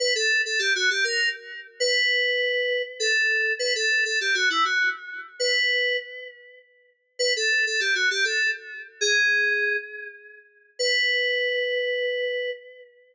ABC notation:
X:1
M:3/4
L:1/16
Q:1/4=100
K:Bm
V:1 name="Electric Piano 2"
B A2 A G F G ^A2 z3 | B8 A4 | B A2 A G F E F2 z3 | B4 z8 |
B A2 A G F G A2 z3 | ^G6 z6 | B12 |]